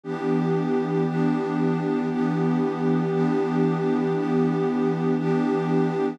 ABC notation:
X:1
M:4/4
L:1/8
Q:"Swing" 1/4=117
K:Edor
V:1 name="Pad 2 (warm)"
[E,B,DG]4 [E,B,DG]4 | [E,B,DG]4 [E,B,DG]4 | [E,B,DG]4 [E,B,DG]4 |]